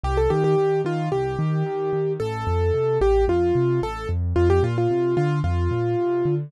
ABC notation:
X:1
M:4/4
L:1/16
Q:1/4=111
K:Gm
V:1 name="Acoustic Grand Piano"
G A G G3 F2 G8 | A6 G2 F4 A2 z2 | F G F F3 F2 F8 |]
V:2 name="Acoustic Grand Piano" clef=bass
C,,2 E,2 E,2 E,2 C,,2 E,2 E,2 E,2 | A,,,2 F,,2 C,2 A,,,2 F,,2 C,2 A,,,2 F,,2 | F,,2 B,,2 C,2 D,2 F,,2 B,,2 C,2 D,2 |]